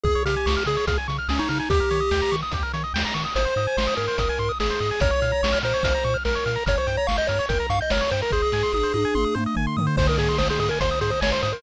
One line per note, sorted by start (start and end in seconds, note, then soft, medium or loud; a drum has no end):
0.04 0.16 C#2 loud
0.04 0.23 G#4 loud
0.04 0.14 G#4 medium
0.04 kick loud
0.15 0.24 C#5 medium
0.25 0.37 C#3 medium
0.25 0.63 G4 medium
0.25 0.35 F5 medium
0.25 closed hi-hat loud
0.36 0.46 G#5 medium
0.46 0.57 C#2 medium
0.46 0.55 C#6 medium
0.46 snare loud
0.57 0.66 F6 medium
0.66 0.78 C#3 medium
0.66 0.76 G#4 medium
0.66 0.85 G#4 medium
0.66 closed hi-hat medium
0.77 0.86 C#5 medium
0.87 0.99 C#2 medium
0.87 0.98 G#4 medium
0.87 0.97 F5 medium
0.87 kick medium
0.87 closed hi-hat loud
0.98 1.07 G#5 medium
1.08 1.20 C#3 medium
1.08 1.17 C#6 medium
1.08 closed hi-hat medium
1.18 1.28 F6 medium
1.28 1.40 C#2 medium
1.28 1.40 C#4 medium
1.28 1.38 G#4 medium
1.28 snare loud
1.39 1.49 D#4 medium
1.39 1.48 C#5 medium
1.49 1.61 C#3 medium
1.49 1.59 D#4 medium
1.49 1.58 F5 medium
1.49 closed hi-hat medium
1.59 1.69 D#4 medium
1.59 1.69 G#5 medium
1.70 1.81 D#2 medium
1.70 2.36 G4 loud
1.70 1.80 G4 medium
1.70 kick loud
1.70 closed hi-hat loud
1.80 1.89 A#4 medium
1.91 2.02 D#3 medium
1.91 2.00 C#5 medium
1.91 closed hi-hat medium
2.00 2.10 D#5 medium
2.11 2.23 D#2 medium
2.11 2.21 G5 medium
2.11 snare loud
2.22 2.31 A#5 medium
2.32 2.43 D#3 medium
2.32 2.41 C#6 medium
2.32 closed hi-hat medium
2.42 2.52 D#6 medium
2.52 2.64 D#2 medium
2.52 2.63 G4 medium
2.52 kick medium
2.52 closed hi-hat loud
2.63 2.72 A#4 medium
2.73 2.85 D#3 medium
2.73 2.83 C#5 medium
2.73 closed hi-hat medium
2.84 2.93 D#5 medium
2.94 3.05 D#2 medium
2.94 3.03 G5 medium
2.94 snare loud
3.05 3.14 A#5 medium
3.14 3.26 D#3 medium
3.14 3.23 C#6 medium
3.14 closed hi-hat medium
3.25 3.34 D#6 medium
3.35 3.47 G#1 loud
3.35 3.44 G#4 medium
3.35 3.94 C5 medium
3.35 closed hi-hat loud
3.45 3.54 C5 medium
3.56 3.67 G#2 medium
3.56 3.66 D#5 medium
3.56 closed hi-hat medium
3.67 3.76 G#5 medium
3.77 3.88 G#1 medium
3.77 3.87 C6 medium
3.77 snare loud
3.87 3.96 D#6 medium
3.96 4.09 G#2 medium
3.96 4.06 G#4 medium
3.96 4.52 A#4 medium
3.96 closed hi-hat medium
4.08 4.17 C5 medium
4.18 4.30 G#1 medium
4.18 4.28 D#5 medium
4.18 kick medium
4.18 closed hi-hat loud
4.29 4.39 G#5 medium
4.38 4.50 G#2 medium
4.38 4.48 C6 medium
4.38 closed hi-hat medium
4.49 4.58 D#6 medium
4.60 4.71 G#1 medium
4.60 4.69 G#4 medium
4.60 5.00 G#4 medium
4.60 snare loud
4.70 4.80 C5 medium
4.80 4.92 G#2 medium
4.80 4.90 D#5 medium
4.91 5.00 G#5 medium
5.00 5.13 A#1 loud
5.00 5.11 A#4 medium
5.00 5.59 C#5 loud
5.00 kick loud
5.00 closed hi-hat loud
5.11 5.20 C#5 medium
5.22 5.33 A#2 medium
5.22 5.31 F5 medium
5.22 closed hi-hat medium
5.32 5.41 A#5 medium
5.43 5.54 A#1 medium
5.43 5.52 C#6 medium
5.43 snare loud
5.52 5.62 F6 medium
5.62 5.74 A#2 medium
5.62 5.73 A#4 medium
5.62 6.17 C5 medium
5.62 closed hi-hat medium
5.74 5.83 C#5 medium
5.83 5.95 A#1 medium
5.83 5.93 F5 medium
5.83 kick loud
5.83 closed hi-hat loud
5.95 6.04 A#5 medium
6.03 6.16 A#2 medium
6.03 6.14 C#6 medium
6.03 closed hi-hat medium
6.14 6.23 F6 medium
6.25 6.37 A#1 medium
6.25 6.64 A#4 medium
6.25 6.35 A#4 medium
6.25 snare loud
6.35 6.44 C#5 medium
6.46 6.57 A#2 medium
6.46 6.55 F5 medium
6.46 closed hi-hat medium
6.56 6.65 A#5 medium
6.66 6.78 G1 loud
6.66 6.75 A#4 medium
6.66 6.78 C#5 loud
6.66 kick loud
6.66 closed hi-hat loud
6.78 6.97 C5 medium
6.78 6.87 C#5 medium
6.87 6.98 G2 medium
6.87 6.96 G5 medium
6.87 closed hi-hat medium
6.97 7.07 C#5 medium
6.97 7.07 A#5 medium
7.07 7.20 G1 medium
7.07 7.17 F5 medium
7.07 7.16 C#6 medium
7.07 snare loud
7.17 7.28 D#5 medium
7.17 7.27 G6 medium
7.27 7.40 G2 medium
7.27 7.38 A#4 medium
7.27 7.46 C#5 medium
7.27 closed hi-hat medium
7.39 7.48 C#5 medium
7.49 7.61 G1 medium
7.49 7.67 A#4 medium
7.49 7.58 G5 medium
7.49 kick medium
7.49 closed hi-hat loud
7.60 7.69 A#5 medium
7.70 7.81 G2 medium
7.70 7.80 F5 medium
7.70 7.79 C#6 medium
7.70 closed hi-hat medium
7.81 7.92 D#5 medium
7.81 7.90 G6 medium
7.90 8.02 G1 medium
7.90 8.01 A#4 medium
7.90 8.11 C#5 medium
7.90 snare loud
8.01 8.10 C#5 medium
8.11 8.23 G2 medium
8.11 8.21 C5 medium
8.11 8.21 G5 medium
8.11 closed hi-hat medium
8.22 8.32 A#4 medium
8.22 8.31 A#5 medium
8.31 8.44 G#1 medium
8.31 9.35 G#4 loud
8.31 8.42 C5 medium
8.31 kick medium
8.42 8.52 D#5 medium
8.52 8.64 G#2 medium
8.52 8.62 G#5 medium
8.52 snare medium
8.63 8.72 C6 medium
8.72 8.85 G#1 medium
8.72 8.84 D#6 medium
8.72 high tom medium
8.83 8.92 C5 medium
8.94 9.05 G#2 medium
8.94 9.03 D#5 medium
8.94 high tom medium
9.05 9.14 G#5 medium
9.14 9.26 G#1 medium
9.14 9.24 C6 medium
9.14 mid tom medium
9.24 9.34 D#6 medium
9.35 9.47 G#2 medium
9.35 9.44 C5 medium
9.35 mid tom medium
9.46 9.55 D#5 medium
9.55 9.68 G#1 medium
9.55 9.66 G#5 medium
9.55 floor tom medium
9.67 9.76 C6 medium
9.77 9.88 G#2 medium
9.77 9.86 D#6 medium
9.77 floor tom loud
9.87 9.96 C5 medium
9.97 10.09 G#1 loud
9.97 10.07 C5 loud
9.97 10.07 C5 medium
9.97 kick loud
9.97 crash loud
10.07 10.19 A#4 medium
10.07 10.16 D#5 medium
10.18 10.29 G#2 medium
10.18 10.37 G#4 medium
10.18 10.28 G#5 medium
10.18 closed hi-hat medium
10.29 10.38 C6 medium
10.38 10.50 G#1 medium
10.38 10.48 C5 medium
10.38 10.48 D#6 medium
10.38 snare loud
10.50 10.59 G#4 medium
10.50 10.59 C5 medium
10.59 10.70 G#2 medium
10.59 10.69 G#4 medium
10.59 10.69 D#5 medium
10.59 closed hi-hat medium
10.69 10.79 A#4 medium
10.69 10.80 G#5 medium
10.80 10.92 G#1 medium
10.80 10.99 C5 medium
10.80 10.90 C6 medium
10.80 kick medium
10.80 closed hi-hat loud
10.91 11.00 D#6 medium
11.01 11.13 G#2 medium
11.01 11.11 G#4 medium
11.01 11.10 C5 medium
11.01 closed hi-hat medium
11.10 11.20 C5 medium
11.10 11.21 D#5 medium
11.21 11.33 G#1 medium
11.21 11.33 C#5 medium
11.21 11.30 G#5 medium
11.21 snare loud
11.32 11.42 C5 medium
11.32 11.41 C6 medium
11.42 11.54 G#2 medium
11.42 11.52 C5 medium
11.42 11.52 D#6 medium
11.42 closed hi-hat medium
11.52 11.62 A#4 medium
11.52 11.62 C5 medium